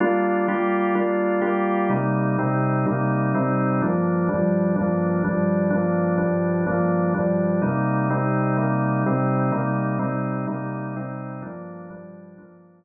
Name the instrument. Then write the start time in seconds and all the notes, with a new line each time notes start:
drawbar organ
0.00 G3 A#3 D4 F4
0.48 G3 A#3 F4 G4
0.95 G3 A#3 D4 F4
1.41 G3 A#3 F4 G4
1.89 C3 G3 A#3 D#4
2.38 C3 G3 C4 D#4
2.86 C3 G3 A#3 D#4
3.34 C3 G3 C4 D#4
3.82 G2 F3 A#3 D4
4.29 G2 F3 G3 D4
4.76 G2 F3 A#3 D4
5.24 G2 F3 G3 D4
5.70 G2 F3 A#3 D4
6.17 G2 F3 G3 D4
6.67 G2 F3 A#3 D4
7.14 G2 F3 G3 D4
7.62 C3 G3 A#3 D#4
8.10 C3 G3 C4 D#4
8.57 C3 G3 A#3 D#4
9.06 C3 G3 C4 D#4
9.52 C3 G3 A#3 D#4
9.99 C3 G3 C4 D#4
10.47 C3 G3 A#3 D#4
10.96 C3 G3 C4 D#4
11.42 G2 F3 A#3 D4
11.90 G2 F3 G3 D4
12.38 G2 F3 A#3 D4